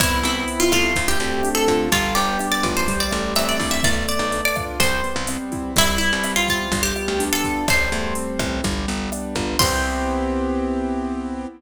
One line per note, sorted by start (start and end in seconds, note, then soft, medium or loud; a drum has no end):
0.00 0.22 C2 medium
0.00 0.91 B3 medium
0.00 0.24 E4 loud
0.00 kick loud
0.00 cross-stick medium
0.00 closed hi-hat loud
0.23 0.45 C2 medium
0.23 0.92 C4 medium
0.23 0.60 E4 medium
0.23 closed hi-hat medium
0.48 0.94 E4 medium
0.48 closed hi-hat medium
0.60 0.71 F4 medium
0.72 0.94 C2 medium
0.72 1.87 A3 loud
0.72 1.07 F4 medium
0.72 kick medium
0.72 cross-stick medium
0.72 closed hi-hat medium
0.95 1.18 D2 medium
0.95 kick medium
0.95 closed hi-hat loud
1.08 1.49 G4 medium
1.20 1.42 D2 medium
1.20 1.88 C4 medium
1.20 closed hi-hat medium
1.43 1.90 D4 medium
1.43 cross-stick medium
1.43 closed hi-hat loud
1.55 1.89 A4 medium
1.67 1.90 D3 medium
1.67 1.91 F4 medium
1.67 kick medium
1.67 closed hi-hat medium
1.92 2.14 G1 medium
1.92 2.83 G3 medium
1.92 2.14 F4 medium
1.92 kick medium
1.92 closed hi-hat medium
2.15 2.38 G1 medium
2.15 2.84 B3 medium
2.15 2.46 G4 medium
2.15 closed hi-hat medium
2.39 2.86 D4 medium
2.39 cross-stick medium
2.39 closed hi-hat medium
2.52 2.73 D5 medium
2.63 3.09 A1 medium
2.63 2.87 F4 medium
2.63 kick medium
2.63 closed hi-hat medium
2.77 2.99 C5 medium
2.88 3.79 G3 loud
2.88 kick medium
2.88 closed hi-hat loud
3.00 3.32 D5 medium
3.11 3.34 A1 medium
3.11 3.80 A3 medium
3.11 cross-stick medium
3.11 closed hi-hat medium
3.35 3.58 A1 medium
3.35 3.82 C4 medium
3.35 3.48 E5 medium
3.35 closed hi-hat medium
3.49 3.72 D5 medium
3.60 3.81 A#1 medium
3.60 3.83 E4 medium
3.60 kick medium
3.60 open hi-hat medium
3.71 3.82 E5 medium
3.83 4.06 B1 medium
3.83 4.75 A3 medium
3.83 4.07 D5 loud
3.83 kick medium
3.83 cross-stick medium
3.83 closed hi-hat loud
4.08 4.76 B3 medium
4.08 4.41 D5 medium
4.08 closed hi-hat medium
4.19 4.41 B1 medium
4.32 4.78 D4 medium
4.32 closed hi-hat medium
4.45 4.57 D5 medium
4.55 4.79 F4 medium
4.55 kick medium
4.55 cross-stick medium
4.55 closed hi-hat medium
4.80 5.01 C2 medium
4.80 5.71 G3 loud
4.80 5.23 C5 medium
4.80 kick medium
4.80 closed hi-hat loud
5.04 5.72 B3 medium
5.04 closed hi-hat medium
5.16 5.38 C2 medium
5.27 5.74 C4 medium
5.27 cross-stick medium
5.27 closed hi-hat loud
5.52 5.75 E4 medium
5.52 kick medium
5.52 closed hi-hat medium
5.76 5.98 C2 medium
5.76 6.67 G3 loud
5.76 5.98 E4 loud
5.76 kick medium
5.76 closed hi-hat loud
5.98 6.68 B3 medium
5.98 6.31 E4 medium
5.98 closed hi-hat medium
6.13 6.34 C2 medium
6.24 6.70 C4 medium
6.24 cross-stick medium
6.24 closed hi-hat loud
6.36 6.47 F4 medium
6.48 6.71 E4 medium
6.48 6.82 F4 medium
6.48 kick medium
6.48 closed hi-hat medium
6.72 6.93 G1 medium
6.72 7.63 G3 medium
6.72 kick medium
6.72 closed hi-hat loud
6.83 7.24 G4 medium
6.96 7.64 B3 medium
6.96 cross-stick medium
6.96 closed hi-hat medium
7.08 7.30 D2 medium
7.20 7.66 D4 medium
7.20 closed hi-hat loud
7.33 7.66 A4 medium
7.44 7.67 F4 medium
7.44 kick medium
7.44 closed hi-hat medium
7.68 7.90 A1 medium
7.68 8.59 G3 loud
7.68 8.34 C5 medium
7.68 kick medium
7.68 cross-stick loud
7.68 closed hi-hat medium
7.92 8.14 E2 medium
7.92 8.61 A3 medium
7.92 closed hi-hat medium
8.15 8.62 C4 medium
8.15 closed hi-hat loud
8.39 8.61 A1 medium
8.39 8.63 E4 medium
8.39 kick medium
8.39 cross-stick medium
8.39 closed hi-hat medium
8.64 8.86 G1 medium
8.64 9.55 G3 loud
8.64 kick medium
8.64 closed hi-hat medium
8.88 9.10 G1 medium
8.88 9.56 B3 medium
8.88 closed hi-hat medium
9.12 9.58 D4 medium
9.12 cross-stick medium
9.12 closed hi-hat medium
9.35 9.57 G1 medium
9.35 9.59 F4 medium
9.35 kick medium
9.35 closed hi-hat medium
9.59 11.46 C2 loud
9.59 11.46 B3 loud
9.59 11.46 C4 loud
9.59 11.46 E4 loud
9.59 11.46 G4 loud
9.59 11.45 C5 loud
9.59 kick loud
9.59 crash loud